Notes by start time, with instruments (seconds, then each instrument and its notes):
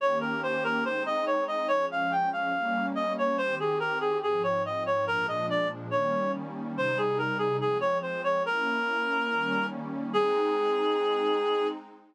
0.00 pad 2 (warm) D#3 A#3 C#4 G4, clarinet C#5
0.21 clarinet A#4
0.43 clarinet C5
0.64 clarinet A#4
0.84 pad 2 (warm) G#3 C4 D#4, clarinet C5
1.06 clarinet D#5
1.26 clarinet C#5
1.48 clarinet D#5
1.68 pad 2 (warm) F3 G#3 C#4, clarinet C#5
1.92 clarinet F5
2.12 clarinet G5
2.33 clarinet F5
2.54 pad 2 (warm) G3 A#3 C#4
2.95 clarinet D#5
3.18 clarinet C#5
3.38 pad 2 (warm) D#3 C4 G4, clarinet C5
3.60 clarinet G#4
3.80 clarinet A#4
4.00 clarinet G#4
4.22 pad 2 (warm) G#2 F3 C4, clarinet G#4
4.43 clarinet C#5
4.65 clarinet D#5
4.86 clarinet C#5
5.07 pad 2 (warm) A#2 F3 G#3 D4, clarinet A#4
5.28 clarinet D#5
5.50 clarinet D5
5.91 pad 2 (warm) D#3 G3 A#3 C#4, clarinet C#5
6.76 pad 2 (warm) C3 G3 D#4, clarinet C5
6.98 clarinet G#4
7.18 clarinet A#4
7.38 clarinet G#4
7.61 pad 2 (warm) F3 G#3 C4, clarinet G#4
7.81 clarinet C#5
8.02 clarinet C5
8.24 clarinet C#5
8.45 pad 2 (warm) A#3 C#4 E4, clarinet A#4
9.30 pad 2 (warm) D#3 G3 A#3 C#4
10.13 pad 2 (warm) G#3 C4 D#4, clarinet G#4